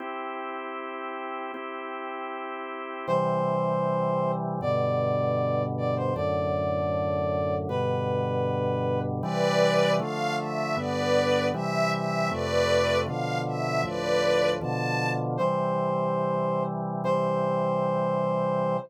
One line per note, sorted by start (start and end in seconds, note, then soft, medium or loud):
0.00 1.52 C4 medium
0.00 1.52 E4 medium
0.00 1.52 G4 medium
1.54 3.06 C4 medium
1.54 3.06 E4 medium
1.54 3.06 G4 medium
3.07 4.60 C3 medium
3.07 4.60 E3 loud
3.07 4.60 G3 medium
3.07 4.32 C5 medium
4.61 6.13 G2 medium
4.61 6.13 B2 loud
4.61 6.13 D3 medium
4.61 5.63 D5 medium
5.78 5.95 D5 medium
5.96 6.14 C5 medium
6.15 7.68 F#2 loud
6.15 7.68 A2 medium
6.15 7.68 D3 medium
6.15 7.55 D5 medium
7.69 9.21 G2 loud
7.69 9.21 B2 loud
7.69 9.21 D3 medium
7.69 9.00 B4 medium
9.22 9.99 C3 loud
9.22 9.99 E3 loud
9.22 9.99 G3 loud
9.22 9.92 B4 medium
9.22 9.92 D5 loud
10.00 10.76 D3 medium
10.00 10.76 F3 medium
10.00 10.76 A3 loud
10.00 10.34 F5 medium
10.38 10.75 E5 medium
10.76 11.52 G2 medium
10.76 11.52 D3 medium
10.76 11.52 B3 medium
10.76 11.46 B4 medium
10.76 11.46 D5 medium
11.54 12.30 C3 loud
11.54 12.30 E3 loud
11.54 12.30 G3 medium
11.54 11.91 E5 medium
11.91 12.28 E5 medium
12.31 13.07 F2 medium
12.31 13.07 C3 loud
12.31 13.07 A3 medium
12.31 12.98 B4 medium
12.31 12.98 D5 loud
13.06 13.83 B2 medium
13.06 13.83 D3 loud
13.06 13.83 F3 medium
13.06 13.38 F5 medium
13.47 13.81 E5 medium
13.83 14.60 D2 medium
13.83 14.60 A2 medium
13.83 14.60 F3 loud
13.83 14.50 B4 medium
13.83 14.50 D5 medium
14.61 15.38 B2 loud
14.61 15.38 D3 loud
14.61 15.38 F3 medium
14.61 15.10 A5 medium
15.37 17.02 C3 medium
15.37 17.02 E3 medium
15.37 17.02 G3 medium
15.37 16.63 C5 medium
17.04 18.77 C3 medium
17.04 18.77 E3 medium
17.04 18.77 G3 medium
17.04 18.77 C5 loud